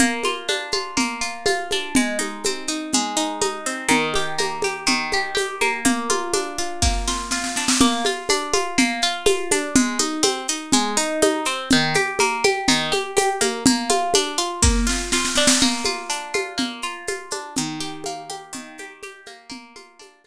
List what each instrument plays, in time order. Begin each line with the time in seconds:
0.00 acoustic guitar (steel) A#3, low conga, shaker
0.23 acoustic guitar (steel) F4, high conga, shaker
0.48 acoustic guitar (steel) D4, high conga, shaker
0.72 acoustic guitar (steel) F4, high conga, shaker
0.97 acoustic guitar (steel) A#3, low conga, shaker
1.21 acoustic guitar (steel) F4, shaker
1.46 acoustic guitar (steel) F4, high conga, shaker
1.71 acoustic guitar (steel) D4, high conga, shaker
1.95 acoustic guitar (steel) G#3, low conga, shaker
2.19 acoustic guitar (steel) D#4, high conga, shaker
2.44 acoustic guitar (steel) C4, high conga, shaker
2.67 acoustic guitar (steel) D#4, shaker
2.92 acoustic guitar (steel) G#3, low conga, shaker
3.16 acoustic guitar (steel) D#4, shaker
3.42 acoustic guitar (steel) D#4, high conga, shaker
3.66 acoustic guitar (steel) C4, shaker
3.89 acoustic guitar (steel) D#3, low conga, shaker
4.14 acoustic guitar (steel) G4, high conga, shaker
4.38 acoustic guitar (steel) A#3, high conga, shaker
4.62 acoustic guitar (steel) G4, high conga, shaker
4.86 acoustic guitar (steel) D#3, low conga, shaker
5.12 acoustic guitar (steel) G4, high conga, shaker
5.35 acoustic guitar (steel) G4, high conga, shaker
5.61 acoustic guitar (steel) A#3, high conga, shaker
5.85 acoustic guitar (steel) A#3, low conga, shaker
6.10 acoustic guitar (steel) F4, high conga, shaker
6.34 acoustic guitar (steel) D4, high conga, shaker
6.58 acoustic guitar (steel) F4, shaker
6.82 acoustic guitar (steel) A#3, kick, snare
7.08 acoustic guitar (steel) F4, snare
7.31 acoustic guitar (steel) F4, snare
7.44 snare
7.56 acoustic guitar (steel) D4, snare
7.68 snare
7.80 acoustic guitar (steel) A#3, low conga, shaker
8.05 acoustic guitar (steel) F4, high conga, shaker
8.29 acoustic guitar (steel) D4, high conga, shaker
8.53 acoustic guitar (steel) F4, high conga, shaker
8.78 acoustic guitar (steel) A#3, low conga, shaker
9.02 acoustic guitar (steel) F4, shaker
9.26 acoustic guitar (steel) F4, high conga, shaker
9.51 acoustic guitar (steel) D4, high conga, shaker
9.76 acoustic guitar (steel) G#3, low conga, shaker
9.99 acoustic guitar (steel) D#4, high conga, shaker
10.23 acoustic guitar (steel) C4, high conga, shaker
10.48 acoustic guitar (steel) D#4, shaker
10.72 acoustic guitar (steel) G#3, low conga, shaker
10.97 acoustic guitar (steel) D#4, shaker
11.22 acoustic guitar (steel) D#4, high conga, shaker
11.45 acoustic guitar (steel) C4, shaker
11.70 acoustic guitar (steel) D#3, low conga, shaker
11.94 acoustic guitar (steel) G4, high conga, shaker
12.19 acoustic guitar (steel) A#3, high conga, shaker
12.44 acoustic guitar (steel) G4, high conga, shaker
12.68 acoustic guitar (steel) D#3, low conga, shaker
12.92 acoustic guitar (steel) G4, high conga, shaker
13.17 acoustic guitar (steel) G4, high conga, shaker
13.41 acoustic guitar (steel) A#3, high conga, shaker
13.66 acoustic guitar (steel) A#3, low conga, shaker
13.90 acoustic guitar (steel) F4, high conga, shaker
14.14 acoustic guitar (steel) D4, high conga, shaker
14.38 acoustic guitar (steel) F4, shaker
14.63 acoustic guitar (steel) A#3, kick, snare
14.87 acoustic guitar (steel) F4, snare
15.12 acoustic guitar (steel) F4, snare
15.25 snare
15.35 acoustic guitar (steel) D4, snare
15.47 snare
15.61 acoustic guitar (steel) A#3, low conga, shaker
15.84 acoustic guitar (steel) F4, high conga, shaker
16.10 acoustic guitar (steel) D4, shaker
16.34 acoustic guitar (steel) F4, high conga, shaker
16.58 acoustic guitar (steel) A#3, low conga, shaker
16.82 acoustic guitar (steel) F4, shaker
17.07 acoustic guitar (steel) F4, high conga, shaker
17.31 acoustic guitar (steel) D4, high conga, shaker
17.56 acoustic guitar (steel) D#3, low conga, shaker
17.80 acoustic guitar (steel) G4, shaker
18.04 acoustic guitar (steel) A#3, high conga, shaker
18.30 acoustic guitar (steel) G4, high conga, shaker
18.53 acoustic guitar (steel) D#3, low conga, shaker
18.78 acoustic guitar (steel) G4, high conga, shaker
19.03 acoustic guitar (steel) G4, high conga, shaker
19.26 acoustic guitar (steel) A#3, high conga, shaker
19.50 acoustic guitar (steel) A#3, low conga, shaker
19.76 acoustic guitar (steel) F4, high conga, shaker
19.99 acoustic guitar (steel) D4, high conga, shaker
20.24 acoustic guitar (steel) F4, high conga, shaker